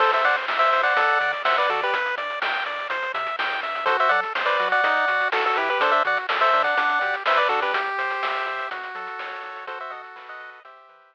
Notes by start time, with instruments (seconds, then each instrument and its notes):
0.00 synth bass 1 A1, lead 1 (square) A4 C5, kick, crash
0.13 lead 1 (square) C5 E5, closed hi-hat
0.24 synth bass 1 A2, lead 1 (square) C5 D5 F#5, closed hi-hat
0.36 closed hi-hat
0.48 synth bass 1 A1, lead 1 (square) E5, snare
0.59 lead 1 (square) C5 E5, closed hi-hat
0.72 synth bass 1 A2, lead 1 (square) C5, closed hi-hat
0.83 lead 1 (square) D5 F#5, closed hi-hat
0.97 synth bass 1 D2, lead 1 (square) A4, kick, closed hi-hat
1.08 closed hi-hat
1.21 synth bass 1 D3, lead 1 (square) D5, closed hi-hat
1.33 closed hi-hat
1.45 synth bass 1 D2, lead 1 (square) C5 E5 F#5, snare
1.57 lead 1 (square) B4 D5, closed hi-hat
1.69 synth bass 1 D3, lead 1 (square) F#4 A4 D5, closed hi-hat
1.82 lead 1 (square) G4 B4, closed hi-hat
1.93 synth bass 1 G1, lead 1 (square) B4, kick, closed hi-hat
2.06 closed hi-hat
2.17 synth bass 1 G2, lead 1 (square) D5, closed hi-hat
2.30 closed hi-hat
2.42 synth bass 1 G1, lead 1 (square) G5, snare
2.54 closed hi-hat
2.66 synth bass 1 G2, lead 1 (square) D5, closed hi-hat
2.79 closed hi-hat
2.90 synth bass 1 C2, lead 1 (square) C5, kick, closed hi-hat
3.02 closed hi-hat
3.14 synth bass 1 C3, lead 1 (square) E5, closed hi-hat
3.27 closed hi-hat
3.39 synth bass 1 G#2, lead 1 (square) G5, snare
3.51 closed hi-hat
3.63 synth bass 1 G2, lead 1 (square) E5, closed hi-hat
3.75 closed hi-hat
3.86 synth bass 1 F#2, lead 1 (square) F#4 A4 C5, kick, closed hi-hat
4.00 lead 1 (square) C5 E5, closed hi-hat
4.09 synth bass 1 F#3, lead 1 (square) A4 D5 F#5, closed hi-hat
4.23 closed hi-hat
4.35 synth bass 1 F#2, lead 1 (square) C5, snare
4.46 lead 1 (square) B4 D5, closed hi-hat
4.60 synth bass 1 F#3, lead 1 (square) F#4, closed hi-hat
4.72 lead 1 (square) D5 F#5, closed hi-hat
4.83 synth bass 1 B1, lead 1 (square) D#4, kick, closed hi-hat
4.96 closed hi-hat
5.08 synth bass 1 B2, lead 1 (square) F#4, closed hi-hat
5.20 closed hi-hat
5.32 synth bass 1 B1, lead 1 (square) F#4 A4, snare
5.46 lead 1 (square) F#4 A4
5.56 synth bass 1 B2, lead 1 (square) E4 G4 B4, closed hi-hat
5.69 lead 1 (square) G4 B4, closed hi-hat
5.80 synth bass 1 D2, lead 1 (square) D4 A4 C5, kick, closed hi-hat
5.92 lead 1 (square) C5 E5, closed hi-hat
6.05 synth bass 1 D3, lead 1 (square) F#4 D5 F#5, closed hi-hat
6.17 closed hi-hat
6.29 synth bass 1 D2, lead 1 (square) A4, snare
6.41 lead 1 (square) C5 E5, closed hi-hat
6.53 synth bass 1 D3, lead 1 (square) D4, closed hi-hat
6.64 lead 1 (square) D5 F#5, closed hi-hat
6.77 synth bass 1 B1, lead 1 (square) D4, kick, closed hi-hat
6.89 closed hi-hat
7.01 synth bass 1 B2, lead 1 (square) G4, closed hi-hat
7.14 closed hi-hat
7.26 synth bass 1 B1, lead 1 (square) B4 C5 E5, snare
7.37 lead 1 (square) B4 D5, closed hi-hat
7.49 synth bass 1 B2, lead 1 (square) D4 F#4 A4, closed hi-hat
7.62 lead 1 (square) G4 B4, closed hi-hat
7.74 synth bass 1 C2, lead 1 (square) G4, kick, closed hi-hat
7.86 closed hi-hat
7.98 synth bass 1 C3, lead 1 (square) C5, closed hi-hat
8.10 closed hi-hat
8.22 synth bass 1 C2, lead 1 (square) E5, snare
8.35 closed hi-hat
8.47 synth bass 1 C3, lead 1 (square) G4, closed hi-hat
8.59 closed hi-hat
8.71 synth bass 1 F#2, lead 1 (square) F#4, kick, closed hi-hat
8.83 closed hi-hat
8.95 synth bass 1 F#3, lead 1 (square) A4, closed hi-hat
9.07 closed hi-hat
9.19 synth bass 1 F#2, lead 1 (square) C#5, snare
9.31 closed hi-hat
9.43 synth bass 1 B1, lead 1 (square) F#4, closed hi-hat
9.56 closed hi-hat
9.67 lead 1 (square) F#4 A4 C5, kick, closed hi-hat
9.80 lead 1 (square) C5 E5, closed hi-hat
9.90 synth bass 1 B2, lead 1 (square) A4 D#5 F#5, closed hi-hat
10.04 closed hi-hat
10.16 synth bass 1 B1, lead 1 (square) B4, snare
10.28 lead 1 (square) D#5 F#5, closed hi-hat
10.40 synth bass 1 B2, lead 1 (square) D#5, closed hi-hat
10.53 closed hi-hat
10.65 synth bass 1 E2, lead 1 (square) G4 C5 E5, kick, closed hi-hat
10.77 closed hi-hat
10.89 synth bass 1 E3, lead 1 (square) B4, closed hi-hat
11.01 closed hi-hat
11.13 synth bass 1 E2, lead 1 (square) E5, snare